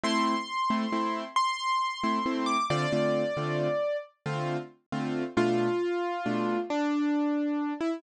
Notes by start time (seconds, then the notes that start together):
0.04 A3 C4 E4 C6
0.70 A3 C4 E4
0.92 A3 C4 E4
1.36 C6
2.04 A3 C4 E4
2.26 A3 C4 E4
2.46 D6
2.70 D3 A3 C4 F4 D5
2.92 D3 A3 C4 F4
3.37 D3 A3 C4 F4
4.26 D3 A3 C4 F4
4.92 D3 A3 C4 F4
5.37 B2 A3 D4 F4
6.26 B2 A3 D4 F4
6.70 D4
7.81 E4